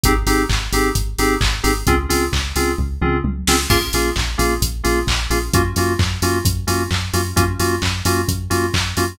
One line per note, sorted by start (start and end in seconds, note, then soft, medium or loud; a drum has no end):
0.04 0.23 G#1 medium
0.04 0.13 C4 loud
0.04 0.13 D#4 medium
0.04 0.13 G4 medium
0.04 0.13 G#4 medium
0.04 kick loud
0.04 closed hi-hat loud
0.27 0.46 G#1 medium
0.27 0.43 C4 medium
0.27 0.43 D#4 loud
0.27 0.43 G4 medium
0.27 0.43 G#4 medium
0.27 open hi-hat medium
0.49 0.69 G#1 medium
0.49 kick medium
0.49 clap loud
0.72 0.92 G#1 medium
0.72 0.89 C4 medium
0.72 0.89 D#4 medium
0.72 0.89 G4 medium
0.72 0.89 G#4 medium
0.72 open hi-hat medium
0.95 1.15 G#1 medium
0.95 kick medium
0.95 closed hi-hat loud
1.18 1.37 G#1 medium
1.18 1.35 C4 medium
1.18 1.35 D#4 medium
1.18 1.35 G4 medium
1.18 1.35 G#4 medium
1.18 open hi-hat medium
1.41 1.61 G#1 medium
1.41 kick loud
1.41 clap loud
1.63 1.83 G#1 medium
1.63 1.71 C4 medium
1.63 1.71 D#4 medium
1.63 1.71 G4 medium
1.63 1.71 G#4 medium
1.63 open hi-hat medium
1.87 2.06 C#2 medium
1.87 1.95 C4 loud
1.87 1.95 C#4 loud
1.87 1.95 F4 loud
1.87 1.95 G#4 loud
1.87 kick loud
1.87 closed hi-hat loud
2.09 2.29 C#2 medium
2.09 2.25 C4 medium
2.09 2.25 C#4 medium
2.09 2.25 F4 medium
2.09 2.25 G#4 medium
2.09 open hi-hat medium
2.33 2.52 C#2 medium
2.33 kick medium
2.33 clap loud
2.55 2.75 C#2 medium
2.55 2.72 C4 medium
2.55 2.72 C#4 medium
2.55 2.72 F4 medium
2.55 2.72 G#4 medium
2.55 open hi-hat medium
2.78 2.98 C#2 medium
2.78 kick medium
3.01 3.21 C#2 medium
3.01 3.18 C4 medium
3.01 3.18 C#4 medium
3.01 3.18 F4 medium
3.01 3.18 G#4 medium
3.01 mid tom loud
3.24 3.44 C#2 medium
3.24 high tom medium
3.47 3.67 C#2 medium
3.47 3.56 C4 loud
3.47 3.56 C#4 medium
3.47 3.56 F4 medium
3.47 3.56 G#4 medium
3.47 snare loud
3.70 3.90 A#1 medium
3.70 3.78 A#3 loud
3.70 3.78 C#4 loud
3.70 3.78 F4 loud
3.70 3.78 G#4 loud
3.70 kick loud
3.70 crash loud
3.93 4.13 A#1 medium
3.93 4.10 A#3 medium
3.93 4.10 C#4 medium
3.93 4.10 F4 medium
3.93 4.10 G#4 medium
3.93 open hi-hat medium
4.16 4.35 A#1 medium
4.16 kick loud
4.16 clap loud
4.38 4.58 A#1 medium
4.38 4.54 A#3 medium
4.38 4.54 C#4 medium
4.38 4.54 F4 medium
4.38 4.54 G#4 medium
4.38 open hi-hat medium
4.62 4.81 A#1 medium
4.62 kick medium
4.62 closed hi-hat loud
4.84 5.04 A#1 medium
4.84 5.00 A#3 medium
4.84 5.00 C#4 medium
4.84 5.00 F4 medium
4.84 5.00 G#4 medium
4.84 open hi-hat medium
5.07 5.27 A#1 medium
5.07 kick loud
5.07 clap loud
5.30 5.50 A#1 medium
5.30 5.38 A#3 medium
5.30 5.38 C#4 medium
5.30 5.38 F4 medium
5.30 5.38 G#4 medium
5.30 open hi-hat medium
5.53 5.73 F#2 medium
5.53 5.62 A#3 loud
5.53 5.62 C#4 medium
5.53 5.62 F4 loud
5.53 5.62 F#4 loud
5.53 kick loud
5.53 closed hi-hat loud
5.76 5.96 F#2 medium
5.76 5.93 A#3 medium
5.76 5.93 C#4 medium
5.76 5.93 F4 medium
5.76 5.93 F#4 medium
5.76 open hi-hat medium
5.99 6.19 F#2 medium
5.99 kick loud
5.99 clap loud
6.22 6.41 F#2 medium
6.22 6.38 A#3 medium
6.22 6.38 C#4 medium
6.22 6.38 F4 medium
6.22 6.38 F#4 medium
6.22 open hi-hat medium
6.45 6.65 F#2 medium
6.45 kick loud
6.45 closed hi-hat loud
6.67 6.87 F#2 medium
6.67 6.83 A#3 medium
6.67 6.83 C#4 medium
6.67 6.83 F4 medium
6.67 6.83 F#4 medium
6.67 open hi-hat medium
6.91 7.10 F#2 medium
6.91 kick medium
6.91 clap loud
7.13 7.33 F#2 medium
7.13 7.21 A#3 medium
7.13 7.21 C#4 medium
7.13 7.21 F4 medium
7.13 7.21 F#4 medium
7.13 open hi-hat medium
7.36 7.56 F#2 medium
7.36 7.44 A#3 loud
7.36 7.44 C#4 loud
7.36 7.44 F4 medium
7.36 7.44 F#4 medium
7.36 kick loud
7.36 closed hi-hat loud
7.59 7.79 F#2 medium
7.59 7.75 A#3 medium
7.59 7.75 C#4 medium
7.59 7.75 F4 medium
7.59 7.75 F#4 medium
7.59 open hi-hat medium
7.82 8.02 F#2 medium
7.82 kick medium
7.82 clap loud
8.05 8.25 F#2 medium
8.05 8.21 A#3 medium
8.05 8.21 C#4 medium
8.05 8.21 F4 medium
8.05 8.21 F#4 medium
8.05 open hi-hat medium
8.28 8.48 F#2 medium
8.28 kick loud
8.28 closed hi-hat loud
8.50 8.71 F#2 medium
8.50 8.66 A#3 medium
8.50 8.66 C#4 medium
8.50 8.66 F4 medium
8.50 8.66 F#4 medium
8.50 open hi-hat medium
8.74 8.94 F#2 medium
8.74 kick medium
8.74 clap loud
8.97 9.17 F#2 medium
8.97 9.05 A#3 medium
8.97 9.05 C#4 medium
8.97 9.05 F4 medium
8.97 9.05 F#4 medium
8.97 open hi-hat medium